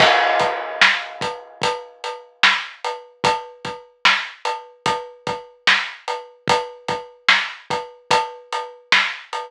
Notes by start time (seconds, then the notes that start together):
0.00 kick, crash
0.40 kick, closed hi-hat
0.81 snare
1.21 kick, closed hi-hat
1.62 kick, closed hi-hat
2.04 closed hi-hat
2.43 snare
2.84 closed hi-hat
3.24 kick, closed hi-hat
3.65 kick, closed hi-hat
4.05 snare
4.45 closed hi-hat
4.86 kick, closed hi-hat
5.27 kick, closed hi-hat
5.67 snare
6.08 closed hi-hat
6.48 kick, closed hi-hat
6.88 kick, closed hi-hat
7.29 snare
7.70 kick, closed hi-hat
8.11 kick, closed hi-hat
8.53 closed hi-hat
8.92 snare
9.33 closed hi-hat